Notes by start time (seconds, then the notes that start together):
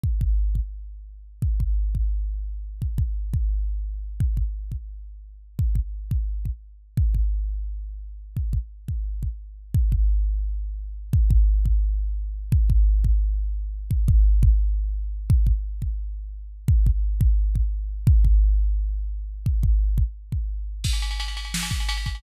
0.04 kick
0.21 kick
0.55 kick
1.42 kick
1.60 kick
1.95 kick
2.82 kick
2.98 kick
3.34 kick
4.20 kick
4.37 kick
4.72 kick
5.59 kick
5.75 kick
6.11 kick
6.45 kick
6.97 kick
7.15 kick
8.37 kick
8.53 kick
8.88 kick
9.23 kick
9.74 kick
9.92 kick
11.13 kick
11.30 kick
11.66 kick
12.52 kick
12.70 kick
13.04 kick
13.91 kick
14.08 kick
14.43 kick
15.30 kick
15.47 kick
15.82 kick
16.68 kick
16.86 kick
17.21 kick
17.55 kick
18.07 kick
18.25 kick
19.46 kick
19.63 kick
19.98 kick
20.32 kick
20.84 kick, crash
20.93 ride
21.02 ride
21.11 ride
21.20 ride
21.28 ride
21.37 ride
21.45 ride
21.54 snare
21.63 ride
21.71 kick, ride
21.80 ride
21.89 ride
21.97 ride
22.06 kick, ride
22.15 ride